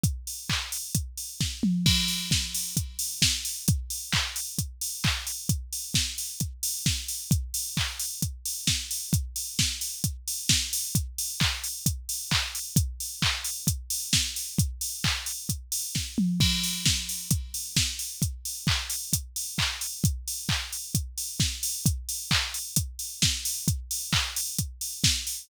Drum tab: CC |--------|x-------|--------|--------|
HH |xo-oxo--|-o-oxo-o|xo-oxo-o|xo-oxo-o|
CP |--x-----|--------|--x---x-|--------|
SD |------o-|--o---o-|--------|--o---o-|
T2 |-------o|--------|--------|--------|
BD |o-o-o-o-|o-o-o-o-|o-o-o-o-|o-o-o-o-|

CC |--------|--------|--------|--------|
HH |xo-oxo-o|xo-oxo-o|xo-oxo-o|xo-oxo-o|
CP |--x-----|--------|--x---x-|--x-----|
SD |------o-|--o---o-|--------|------o-|
T2 |--------|--------|--------|--------|
BD |o-o-o-o-|o-o-o-o-|o-o-o-o-|o-o-o-o-|

CC |--------|x-------|--------|--------|
HH |xo-oxo--|-o-oxo-o|xo-oxo-o|xo-oxo-o|
CP |--x-----|--------|--x---x-|--x-----|
SD |------o-|--o---o-|--------|------o-|
T2 |-------o|--------|--------|--------|
BD |o-o-o-o-|o-o-o-o-|o-o-o-o-|o-o-o-o-|

CC |--------|--------|
HH |xo-oxo-o|xo-oxo-o|
CP |--x-----|--x-----|
SD |------o-|------o-|
T2 |--------|--------|
BD |o-o-o-o-|o-o-o-o-|